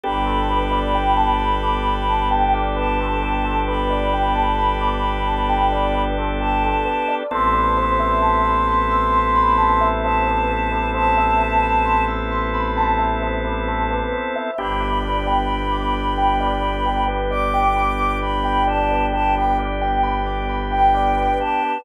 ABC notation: X:1
M:4/4
L:1/16
Q:1/4=66
K:Gmix
V:1 name="Choir Aahs"
b12 a4 | b12 a4 | c'12 a4 | a6 z10 |
b12 d'4 | b2 a2 a g z5 g3 a2 |]
V:2 name="Tubular Bells"
G A B d g a b d' b a g d B A G A | B d g a b d' b a g d B A G A B d | A B c e a b c' e' c' b a e c B A B | c e a b c' e' c' b a e c B A B c e |
G B d g b d' b g d B G B d g b d' | b g d B G B d g b d' b g d B G B |]
V:3 name="Drawbar Organ"
[B,DGA]16- | [B,DGA]16 | [B,CEA]16- | [B,CEA]16 |
[B,DG]16- | [B,DG]16 |]
V:4 name="Violin" clef=bass
G,,,16- | G,,,16 | A,,,16- | A,,,16 |
G,,,16- | G,,,16 |]